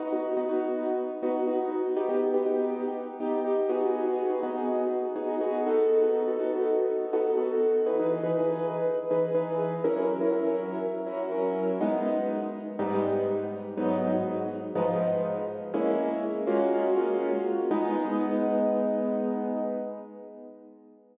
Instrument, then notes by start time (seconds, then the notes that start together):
acoustic grand piano
0.00 B3 D#4 F#4
0.13 B3 D#4 F#4
0.37 B3 D#4 F#4
0.49 B3 D#4 F#4
1.23 B3 D#4 F#4
1.47 B3 D#4 F#4
1.97 B3 D#4 G4
2.09 B3 D#4 G4
2.34 B3 D#4 G4
2.46 B3 D#4 G4
3.20 B3 D#4 G4
3.45 B3 D#4 G4
3.69 B3 D#4 F#4 G#4
4.06 B3 D#4 F#4 G#4
4.30 B3 D#4 F#4 G#4
4.43 B3 D#4 F#4 G#4
5.16 B3 D#4 F#4 G#4
5.41 B3 D#4 F#4 G#4
5.67 B3 D#4 F#4 A4
6.02 B3 D#4 F#4 A4
6.27 B3 D#4 F#4 A4
6.39 B3 D#4 F#4 A4
7.13 B3 D#4 F#4 A4
7.37 B3 D#4 F#4 A4
7.86 E3 D#4 G#4 B4
8.00 E3 D#4 G#4 B4
8.23 E3 D#4 G#4 B4
8.37 E3 D#4 G#4 B4
9.11 E3 D#4 G#4 B4
9.35 E3 D#4 G#4 B4
9.84 F#3 C#4 E4 A#4
9.97 F#3 C#4 E4 A#4
10.21 F#3 C#4 E4 A#4
10.32 F#3 C#4 E4 A#4
11.06 F#3 C#4 E4 A#4
11.32 F#3 C#4 E4 A#4
11.81 G#3 B3 D#4
12.79 G#2 G3 B3 D#4
13.77 G#2 F#3 B3 D#4
14.75 G#2 F3 B3 D#4
15.74 G#3 A#3 C#4 E4
16.47 G#3 A#3 C#4 F4 F#4
16.96 G#3 A#3 C#4 F4 F#4
17.71 G#3 B3 D#4